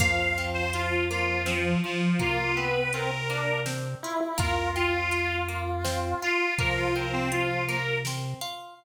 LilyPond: <<
  \new Staff \with { instrumentName = "Harmonica" } { \time 3/4 \key f \major \tempo 4 = 82 f''8. c''16 f'8 f'8 f8 f8 | f'8 ces''8 bes'4 r4 | bes'8 f'4 r4 f'8 | bes'16 f'16 bes'16 c'16 f'8 bes'8 r4 | }
  \new Staff \with { instrumentName = "Lead 1 (square)" } { \time 3/4 \key f \major f2. | bes8 b8 c'16 r16 d'8 r8 e'16 e'16 | f'2. | f2 r4 | }
  \new Staff \with { instrumentName = "Orchestral Harp" } { \time 3/4 \key f \major bes8 c'8 f'8 bes8 c'8 f'8 | bes8 c'8 f'8 bes8 c'8 f'8 | bes8 c'8 f'8 bes8 c'8 f'8 | bes8 c'8 f'8 bes8 c'8 f'8 | }
  \new Staff \with { instrumentName = "Synth Bass 1" } { \clef bass \time 3/4 \key f \major f,2. | c2. | f,2. | c2. | }
  \new DrumStaff \with { instrumentName = "Drums" } \drummode { \time 3/4 <cymc bd>4 hh4 sn4 | <hh bd>4 hh4 sn4 | <hh bd>4 hh4 sn4 | <hh bd>4 hh4 sn4 | }
>>